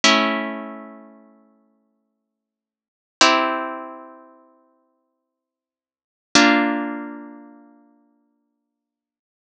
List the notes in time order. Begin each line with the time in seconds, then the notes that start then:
0.04 A3 C#4 E4
3.21 C4 E4 G4
6.35 A#3 D4 F4